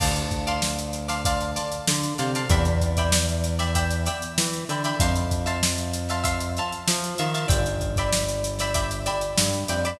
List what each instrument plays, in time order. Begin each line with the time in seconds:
0.00 synth bass 1 D2, pizzicato strings D5 F5 A5 C6, kick, crash
0.16 closed hi-hat
0.31 kick, closed hi-hat
0.47 pizzicato strings D5 F5 A5 C6, closed hi-hat
0.62 snare
0.79 closed hi-hat
0.93 closed hi-hat
1.08 pizzicato strings D5 F5 A5 C6, snare, closed hi-hat
1.25 pizzicato strings D5 F5 A5 C6, kick, closed hi-hat
1.40 snare, closed hi-hat
1.56 pizzicato strings D5 F5 A5 C6, snare, closed hi-hat
1.72 closed hi-hat
1.88 synth bass 1 D3, snare
2.03 snare, closed hi-hat
2.18 synth bass 1 C3, pizzicato strings D5 F5 A5 C6, closed hi-hat
2.35 pizzicato strings D5 F5 A5 C6, closed hi-hat
2.49 synth bass 1 E2, pizzicato strings D5 E5 G5 B5, kick, closed hi-hat
2.65 closed hi-hat
2.81 kick, closed hi-hat
2.97 pizzicato strings D5 E5 G5 B5, kick, closed hi-hat
3.12 snare
3.28 closed hi-hat
3.44 closed hi-hat
3.59 pizzicato strings D5 E5 G5 B5, snare, closed hi-hat
3.75 pizzicato strings D5 E5 G5 B5, kick, closed hi-hat
3.90 closed hi-hat
4.06 pizzicato strings D5 E5 G5 B5, snare, closed hi-hat
4.22 closed hi-hat
4.38 synth bass 1 E3, snare
4.53 closed hi-hat
4.69 synth bass 1 D3, pizzicato strings D5 E5 G5 B5, closed hi-hat
4.84 pizzicato strings D5 E5 G5 B5, closed hi-hat
5.00 synth bass 1 F2, pizzicato strings E5 F5 A5 C6, kick, closed hi-hat
5.15 closed hi-hat
5.31 kick, closed hi-hat
5.46 pizzicato strings E5 F5 A5 C6, closed hi-hat
5.63 snare
5.78 closed hi-hat
5.93 closed hi-hat
6.09 pizzicato strings E5 F5 A5 C6, snare, closed hi-hat
6.24 pizzicato strings E5 F5 A5 C6, kick, closed hi-hat
6.40 closed hi-hat
6.57 pizzicato strings E5 F5 A5 C6, closed hi-hat
6.72 closed hi-hat
6.88 synth bass 1 F3, snare
7.04 closed hi-hat
7.18 synth bass 1 D#3, pizzicato strings E5 F5 A5 C6, closed hi-hat
7.34 pizzicato strings E5 F5 A5 C6, closed hi-hat
7.48 synth bass 1 G1, pizzicato strings D5 E5 G5 B5, kick, closed hi-hat
7.66 closed hi-hat
7.81 kick, closed hi-hat
7.96 pizzicato strings D5 E5 G5 B5, kick, closed hi-hat
8.12 snare
8.28 snare, closed hi-hat
8.44 closed hi-hat
8.59 pizzicato strings D5 E5 G5 B5, snare, closed hi-hat
8.74 pizzicato strings D5 E5 G5 B5, kick, closed hi-hat
8.91 closed hi-hat
9.06 pizzicato strings D5 E5 G5 B5, closed hi-hat
9.21 closed hi-hat
9.38 synth bass 1 G2, snare
9.53 closed hi-hat
9.68 synth bass 1 F2, pizzicato strings D5 E5 G5 B5, closed hi-hat
9.85 pizzicato strings D5 E5 G5 B5, closed hi-hat